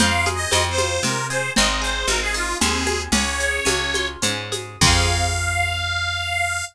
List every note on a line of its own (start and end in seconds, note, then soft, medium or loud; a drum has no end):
0.00 0.46 F2 medium
0.00 0.51 C4 loud
0.00 0.29 F5 medium
0.00 low conga loud
0.00 shaker medium
0.26 1.30 G#4 medium
0.26 high conga medium
0.26 shaker medium
0.35 0.64 D#5 loud
0.51 0.99 F2 medium
0.51 1.04 C4 medium
0.51 tambourine medium
0.51 high conga medium
0.51 shaker medium
0.70 1.02 C5 medium
0.78 1.53 F4 medium
0.78 high conga medium
0.78 shaker medium
1.03 1.50 C3 medium
1.03 1.54 C4 medium
1.03 1.27 A#4 medium
1.03 low conga medium
1.03 shaker medium
1.30 1.55 G#4 medium
1.30 1.52 C5 medium
1.30 shaker medium
1.56 2.05 G#1 medium
1.56 2.07 C4 loud
1.56 1.68 D#5 loud
1.56 low conga loud
1.56 shaker medium
1.69 1.81 D#5 medium
1.82 2.86 G#4 medium
1.82 2.08 C5 medium
1.82 shaker medium
2.07 2.54 G#1 medium
2.07 2.61 C4 medium
2.07 2.20 A#4 medium
2.07 high conga medium
2.07 shaker medium
2.22 2.34 G#4 medium
2.34 3.09 D#4 medium
2.34 2.57 F4 medium
2.34 shaker medium
2.60 3.08 D#2 medium
2.60 3.11 C4 loud
2.60 3.02 G#4 medium
2.60 low conga medium
2.60 shaker medium
2.87 3.12 G#4 medium
2.87 high conga medium
2.87 shaker medium
3.12 3.60 C#2 medium
3.12 3.65 C#4 medium
3.12 4.08 C#5 medium
3.12 low conga loud
3.12 shaker medium
3.40 4.51 G#4 medium
3.40 shaker medium
3.65 4.17 C#2 medium
3.65 4.22 C#4 medium
3.65 tambourine medium
3.65 high conga loud
3.65 shaker medium
3.94 4.79 F4 medium
3.94 high conga medium
3.94 shaker medium
4.22 4.76 G#2 medium
4.22 4.79 C#4 medium
4.22 low conga medium
4.22 shaker loud
4.52 4.81 G#4 medium
4.52 high conga medium
4.52 shaker medium
4.81 6.63 F2 loud
4.81 6.62 C4 loud
4.81 6.62 F4 loud
4.81 6.65 F5 loud
4.81 kick loud
4.81 crash loud
4.86 6.62 G#4 loud